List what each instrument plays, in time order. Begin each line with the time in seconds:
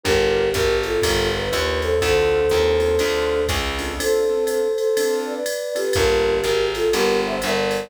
0.04 electric bass (finger) G1, acoustic grand piano D4 F4 G4 A#4, flute G4 A#4, kick, ride
0.53 electric bass (finger) G#1, flute G4 A#4, kick, hi-hat pedal, ride
0.83 flute F4 A4, ride
1.02 electric bass (finger) G1, acoustic grand piano D4 F4 G4 A#4, kick, ride
1.36 flute B4
1.52 electric bass (finger) D#2, acoustic grand piano D4 F4 G4 A#4, hi-hat pedal, ride
1.81 flute A4 C5, ride
2.01 electric bass (finger) D2, acoustic grand piano C4 D4 F4 A4, flute A4 C5, kick, ride
2.49 electric bass (finger) D#2, acoustic grand piano C4 D4 F4 A4, hi-hat pedal, ride
2.80 acoustic grand piano C4 D4 F4 A4, ride
2.99 electric bass (finger) D2, acoustic grand piano C4 D4 F4 A4, ride
3.48 electric bass (finger) C#2, kick, hi-hat pedal, ride
3.78 acoustic grand piano C4 D4 F4 A4, ride
3.99 acoustic grand piano C4 D4 F4 A4, flute A4 C5, ride
4.29 acoustic grand piano C4 D4 F4 A4
4.46 flute A4 C5, hi-hat pedal, ride
4.75 flute A4 C5, ride
4.97 acoustic grand piano C4 D4 F4 A4, ride
5.26 flute B4 D5
5.46 hi-hat pedal, ride
5.75 acoustic grand piano C4 D4 F4 A4, flute G4 B4, ride
5.93 electric bass (finger) G1, acoustic grand piano A#3 D4 F4 G4, flute G4 A#4, kick, ride
6.41 electric bass (finger) G#1, flute G4 A#4, hi-hat pedal, ride
6.74 flute F4 A4, ride
6.93 electric bass (finger) G1, acoustic grand piano A#3 D4 F4 G4, flute G4 A#4, ride
7.26 flute C5 E5
7.42 electric bass (finger) G1, flute A#4 D5, hi-hat pedal, ride
7.71 ride